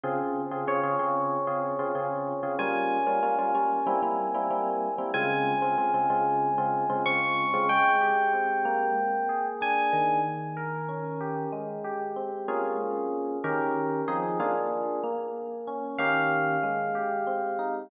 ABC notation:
X:1
M:4/4
L:1/16
Q:1/4=94
K:Fm
V:1 name="Electric Piano 1"
z4 d12 | a16 | a12 d'4 | [K:Ab] g12 a4 |
z16 | z16 | z4 f12 |]
V:2 name="Electric Piano 1"
[D,CFA]3 [D,CFA] [D,CFA] [D,CFA] [D,CFA]3 [D,CFA]2 [D,CFA] [D,CFA]3 [D,CFA] | [G,B,DF]3 [G,B,DF] [G,B,DF] [G,B,DF] [G,B,DF]2 [G,B,C=E] [G,B,CE]2 [G,B,CE] [G,B,CE]3 [G,B,CE] | [D,A,CF]3 [D,A,CF] [D,A,CF] [D,A,CF] [D,A,CF]3 [D,A,CF]2 [D,A,CF] [D,A,CF]3 [D,A,CF] | [K:Ab] A,2 G2 C2 B,4 A2 =D2 E,2- |
E,2 B2 D2 G2 A,2 G2 C2 [B,DFA]2- | [B,DFA]4 [E,DGB]4 [F,CEA]2 [B,=DFA]4 B,2- | B,2 D2 [E,B,DG]4 A,2 G2 C2 E2 |]